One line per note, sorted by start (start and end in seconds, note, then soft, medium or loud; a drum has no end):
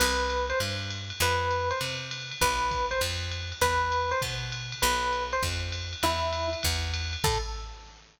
0.00 0.53 C2 loud
0.00 0.46 B4 medium
0.00 crash loud
0.00 ride loud
0.30 hi-hat pedal medium
0.30 ride medium
0.50 0.59 C5 medium
0.50 ride medium
0.60 1.12 G2 medium
0.60 ride loud
0.90 hi-hat pedal medium
0.90 ride medium
1.10 ride medium
1.20 1.72 F2 loud
1.20 1.69 B4 loud
1.20 ride loud
1.51 hi-hat pedal medium
1.51 ride medium
1.71 1.79 C5 medium
1.71 ride medium
1.81 2.33 C3 medium
1.81 ride loud
2.11 hi-hat pedal loud
2.11 ride loud
2.31 ride medium
2.41 2.94 B1 loud
2.41 2.86 B4 medium
2.41 kick medium
2.41 ride loud
2.71 kick medium
2.71 hi-hat pedal medium
2.71 ride medium
2.91 3.00 C5 medium
2.91 ride medium
3.01 3.53 F2 loud
3.01 ride loud
3.31 hi-hat pedal medium
3.31 ride medium
3.52 ride medium
3.61 4.14 E2 loud
3.61 4.10 B4 loud
3.61 kick medium
3.61 ride loud
3.92 hi-hat pedal medium
3.92 ride medium
4.11 4.20 C5 medium
4.11 ride medium
4.22 4.74 B2 loud
4.22 kick medium
4.22 ride loud
4.52 hi-hat pedal medium
4.52 ride medium
4.72 ride medium
4.82 5.35 B1 loud
4.82 5.23 B4 medium
4.82 ride loud
5.13 hi-hat pedal medium
5.13 ride medium
5.32 5.42 C5 medium
5.32 ride medium
5.43 5.95 F2 medium
5.43 kick medium
5.43 ride loud
5.72 hi-hat pedal medium
5.72 ride loud
5.93 ride medium
6.03 6.55 E2 medium
6.03 6.47 E4 loud
6.03 ride loud
6.33 hi-hat pedal medium
6.33 ride loud
6.53 ride medium
6.63 7.17 E2 loud
6.63 kick medium
6.63 ride loud
6.94 hi-hat pedal medium
6.94 ride loud
7.13 ride medium
7.24 7.38 A2 loud
7.24 7.38 A4 loud
7.24 kick loud
7.24 crash loud